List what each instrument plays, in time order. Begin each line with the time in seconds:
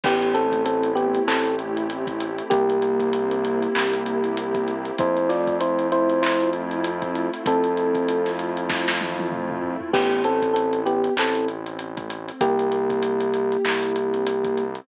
0.03 synth bass 1 A1, pad 2 (warm) A3, electric piano 1 B3 G4, kick, crash
0.22 closed hi-hat
0.34 electric piano 1 C4 A4, pad 2 (warm) C4, closed hi-hat
0.52 kick, closed hi-hat
0.65 electric piano 1 C4 A4, pad 2 (warm) E4, closed hi-hat
0.83 closed hi-hat
0.95 electric piano 1 B3 G4, pad 2 (warm) G4, closed hi-hat
1.14 closed hi-hat
1.26 synth bass 1 A1, electric piano 1 C4 A4, pad 2 (warm) E4, clap
1.45 closed hi-hat
1.59 pad 2 (warm) C4, closed hi-hat
1.77 closed hi-hat
1.89 pad 2 (warm) A3, closed hi-hat
2.07 kick, closed hi-hat
2.20 pad 2 (warm) C4, closed hi-hat
2.38 closed hi-hat
2.50 synth bass 1 C2, electric piano 1 A#3 G4, pad 2 (warm) A#3, kick, closed hi-hat
2.69 closed hi-hat
2.82 pad 2 (warm) C4, closed hi-hat
3.00 kick, closed hi-hat
3.13 pad 2 (warm) E4, closed hi-hat
3.31 closed hi-hat
3.44 pad 2 (warm) G4, closed hi-hat
3.62 closed hi-hat
3.75 synth bass 1 C2, pad 2 (warm) E4, clap
3.93 closed hi-hat
4.06 pad 2 (warm) C4, closed hi-hat
4.24 closed hi-hat
4.37 pad 2 (warm) A#3, closed hi-hat
4.55 kick, closed hi-hat
4.68 pad 2 (warm) C4, closed hi-hat
4.85 closed hi-hat
4.98 synth bass 1 F2, pad 2 (warm) A3, electric piano 1 E4 C5, kick, closed hi-hat
5.17 closed hi-hat
5.29 pad 2 (warm) C4, electric piano 1 F4 D5, snare, closed hi-hat
5.47 kick, closed hi-hat
5.60 pad 2 (warm) E4, electric piano 1 E4 C5, closed hi-hat
5.79 closed hi-hat
5.91 electric piano 1 E4 C5, pad 2 (warm) F4, closed hi-hat
6.09 closed hi-hat
6.22 electric piano 1 E4 C5, pad 2 (warm) E4, clap
6.40 closed hi-hat
6.53 pad 2 (warm) C4, closed hi-hat
6.71 closed hi-hat
6.84 pad 2 (warm) A3, closed hi-hat
7.02 kick, closed hi-hat
7.15 pad 2 (warm) C4, closed hi-hat
7.33 closed hi-hat
7.46 synth bass 1 F2, electric piano 1 C4 A4, pad 2 (warm) E4, kick, closed hi-hat
7.64 closed hi-hat
7.77 pad 2 (warm) F4, closed hi-hat
7.95 kick, closed hi-hat
8.08 pad 2 (warm) E4, closed hi-hat
8.26 snare, closed hi-hat
8.38 pad 2 (warm) C4, closed hi-hat
8.57 closed hi-hat
8.69 pad 2 (warm) A3, kick, snare
8.88 snare
9.00 pad 2 (warm) C4, high tom
9.19 high tom
9.32 pad 2 (warm) E4, mid tom
9.50 mid tom
9.62 pad 2 (warm) F4, floor tom
9.81 floor tom
9.93 synth bass 1 A1, pad 2 (warm) A3, electric piano 1 B3 G4, kick, crash
10.11 closed hi-hat
10.24 pad 2 (warm) C4, electric piano 1 C4 A4, closed hi-hat
10.42 kick, closed hi-hat
10.54 electric piano 1 C4 A4, pad 2 (warm) E4, closed hi-hat
10.73 closed hi-hat
10.86 electric piano 1 B3 G4, pad 2 (warm) G4, closed hi-hat
11.04 closed hi-hat
11.16 synth bass 1 A1, electric piano 1 C4 A4, pad 2 (warm) E4, clap
11.35 closed hi-hat
11.48 pad 2 (warm) C4, closed hi-hat
11.66 closed hi-hat
11.79 pad 2 (warm) A3, closed hi-hat
11.97 kick, closed hi-hat
12.10 pad 2 (warm) C4, closed hi-hat
12.28 closed hi-hat
12.41 synth bass 1 C2, electric piano 1 A#3 G4, pad 2 (warm) A#3, kick, closed hi-hat
12.59 closed hi-hat
12.72 pad 2 (warm) C4, closed hi-hat
12.90 kick, closed hi-hat
13.02 pad 2 (warm) E4, closed hi-hat
13.20 closed hi-hat
13.34 pad 2 (warm) G4, closed hi-hat
13.52 closed hi-hat
13.65 synth bass 1 C2, pad 2 (warm) E4, clap
13.83 closed hi-hat
13.96 pad 2 (warm) C4, closed hi-hat
14.14 closed hi-hat
14.26 pad 2 (warm) A#3, closed hi-hat
14.44 kick, closed hi-hat
14.57 pad 2 (warm) C4, closed hi-hat
14.75 closed hi-hat